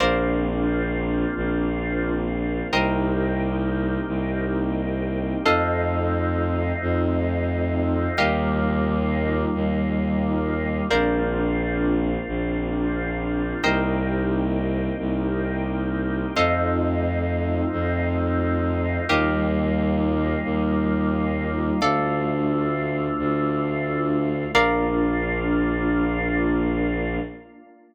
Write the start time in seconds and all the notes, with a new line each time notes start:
0.00 A#1 A#3 C4 D4 F4 A#4 C5 D5 F5
1.37 A#1
2.72 C2 A#3 C4 D#4 G4 A#4 C5 D#5 G5
4.08 C2
5.45 F2 A3 C4 D#4 F4 A4 C5 D#5 F5
6.82 F2
8.17 D#2 G3 A#3 D#4 F4 G4 A#4 D#5 F5
9.55 D#2
10.90 A#1 A#3 C4 D4 F4 A#4 C5 D5 F5
12.28 A#1
13.63 C2 A#3 C4 D#4 G4 A#4 C5 D#5 G5
14.99 C2
16.36 F2 A3 C4 D#4 F4 A4 C5 D#5 F5
17.72 F2
19.09 D#2 G3 A#3 D#4 F4 G4 A#4 D#5 F5
20.44 D#2
21.81 D2 A3 D4 F4 A4 D5 F5
23.19 D2
24.54 A#1 A#3 D4 F4 A#4 D5 F5